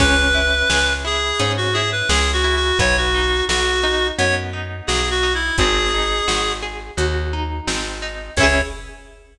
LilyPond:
<<
  \new Staff \with { instrumentName = "Clarinet" } { \time 4/4 \key cis \minor \tempo 4 = 86 b'4. gis'8. fis'16 gis'16 b'16 \tuplet 3/2 { gis'8 fis'8 fis'8 } | cis''16 fis'8. fis'4 cis''16 r8. \tuplet 3/2 { gis'8 fis'8 e'8 } | gis'4. r2 r8 | cis''4 r2. | }
  \new Staff \with { instrumentName = "Orchestral Harp" } { \time 4/4 \key cis \minor cis'8 e'8 gis'8 e'8 cis'8 e'8 gis'8 e'8 | b8 dis'8 fis'8 dis'8 b8 dis'8 fis'8 dis'8 | bis8 dis'8 fis'8 gis'8 fis'8 dis'8 bis8 dis'8 | <cis' e' gis'>4 r2. | }
  \new Staff \with { instrumentName = "Electric Bass (finger)" } { \clef bass \time 4/4 \key cis \minor cis,4 cis,4 gis,4 cis,4 | b,,4 b,,4 fis,4 b,,4 | gis,,4 gis,,4 dis,4 gis,,4 | cis,4 r2. | }
  \new DrumStaff \with { instrumentName = "Drums" } \drummode { \time 4/4 <cymc bd>4 sn4 hh4 sn4 | <hh bd>4 sn4 hh4 sn4 | <hh bd>4 sn4 hh4 sn4 | <cymc bd>4 r4 r4 r4 | }
>>